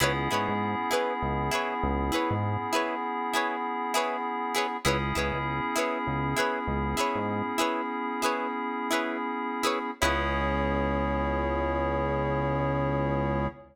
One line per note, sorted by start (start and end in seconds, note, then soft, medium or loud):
0.00 0.29 C#2 medium
0.00 4.77 B3 medium
0.00 4.77 C#4 medium
0.00 0.13 E4 loud
0.00 4.77 E4 medium
0.00 4.77 G#4 medium
0.00 0.13 G#4 loud
0.00 0.13 B4 loud
0.00 0.13 C#5 loud
0.31 0.48 G#2 medium
0.31 0.53 E4 medium
0.31 0.53 G#4 medium
0.31 0.53 B4 medium
0.31 0.53 C#5 medium
0.49 0.75 G#2 medium
0.91 1.14 E4 medium
0.91 1.14 G#4 medium
0.91 1.14 B4 medium
0.91 1.14 C#5 medium
1.22 1.50 C#2 medium
1.51 1.74 E4 medium
1.51 1.74 G#4 medium
1.51 1.74 B4 medium
1.51 1.74 C#5 medium
1.83 2.11 C#2 medium
2.12 2.35 E4 medium
2.12 2.35 G#4 medium
2.12 2.35 B4 medium
2.12 2.35 C#5 medium
2.31 2.57 G#2 medium
2.73 2.95 E4 medium
2.73 2.95 G#4 medium
2.73 2.95 B4 medium
2.73 2.95 C#5 medium
3.33 3.56 E4 medium
3.33 3.56 G#4 medium
3.33 3.56 B4 medium
3.33 3.56 C#5 medium
3.94 4.17 E4 medium
3.94 4.17 G#4 loud
3.94 4.17 B4 loud
3.94 4.17 C#5 medium
4.55 4.67 E4 loud
4.55 4.67 G#4 medium
4.55 4.67 B4 medium
4.55 4.67 C#5 medium
4.84 5.13 C#2 medium
4.84 9.91 B3 medium
4.84 9.91 C#4 medium
4.84 9.91 E4 medium
4.84 4.97 E4 loud
4.84 9.91 G#4 medium
4.84 4.97 G#4 loud
4.84 4.97 B4 loud
4.84 4.97 C#5 loud
5.15 5.32 C#2 medium
5.15 5.38 E4 medium
5.15 5.38 G#4 medium
5.15 5.38 B4 medium
5.15 5.38 C#5 medium
5.34 5.60 C#2 medium
5.76 5.98 E4 medium
5.76 5.98 G#4 medium
5.76 5.98 B4 medium
5.76 5.98 C#5 medium
6.07 6.35 C#2 medium
6.36 6.59 E4 medium
6.36 6.59 G#4 medium
6.36 6.59 B4 medium
6.36 6.59 C#5 medium
6.67 6.95 C#2 medium
6.97 7.20 E4 medium
6.97 7.20 G#4 medium
6.97 7.20 B4 medium
6.97 7.20 C#5 medium
7.15 7.42 G#2 medium
7.58 7.82 E4 medium
7.58 7.82 G#4 medium
7.58 7.82 B4 medium
7.58 7.82 C#5 medium
8.22 8.47 E4 medium
8.22 8.47 G#4 medium
8.22 8.47 B4 medium
8.22 8.47 C#5 medium
8.91 9.17 E4 medium
8.91 9.17 G#4 medium
8.91 9.17 B4 medium
8.91 9.17 C#5 medium
9.63 9.79 E4 loud
9.63 9.79 G#4 medium
9.63 9.79 B4 medium
9.63 9.79 C#5 medium
10.01 13.48 C#2 loud
10.01 13.47 B3 loud
10.01 13.47 C#4 loud
10.01 13.47 E4 loud
10.01 13.47 G#4 medium
10.01 13.47 G#4 loud
10.01 13.47 B4 medium
10.01 13.46 C#5 loud
10.05 13.47 C#5 loud